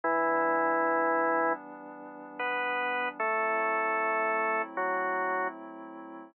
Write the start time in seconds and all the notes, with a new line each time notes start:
0.03 E3 G3 B3 D4 E4
2.39 B3 B4
3.19 F#3 A3 C4 E4 A4
4.77 F#3 F#4